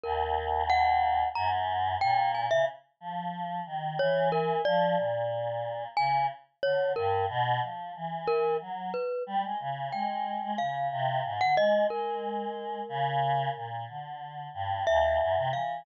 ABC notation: X:1
M:6/8
L:1/16
Q:3/8=61
K:none
V:1 name="Glockenspiel"
_B4 _g4 _b z3 | g2 _a e z8 | _d2 _B2 =d8 | _a2 z2 _d2 _B2 z4 |
z2 _B2 z2 =B2 z4 | g4 f5 _g _e2 | _B12 | z6 e4 f2 |]
V:2 name="Choir Aahs" clef=bass
_E,,8 _G,,4 | _B,,3 _D, z2 F,4 _E,2 | E,4 F,2 _B,,6 | _D,2 z2 =D,2 G,,2 B,,2 F,2 |
E,4 _G,2 z2 =G, _A, _D,2 | _A,3 A, _D,2 C,2 _A,, =D, A,2 | _A,6 _D,4 _B,,2 | D,4 G,,2 _E,,2 _G,, C, =E,2 |]